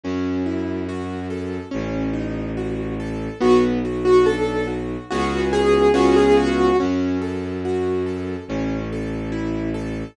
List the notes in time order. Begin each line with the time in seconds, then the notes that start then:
0.04 F#2 C#4
0.46 E4
0.89 F#4
1.30 A4
1.71 A1 C#4
2.13 D#4
2.57 F#4
3.00 A4
3.40 B1 B3 F#4
3.85 F#4
4.05 F#4
4.26 D4 A4
4.67 F#4
5.11 C#2 B3 C#4 F#4 G#4
5.53 G#4
5.94 C#2 B3 C#4 F4 F#4 G#4
6.16 G#4
6.37 F#4
6.80 F#2 C#4
7.21 A4
7.65 F#4
8.06 A4
8.48 A1 C#4
8.92 A4
9.32 E4
9.74 A4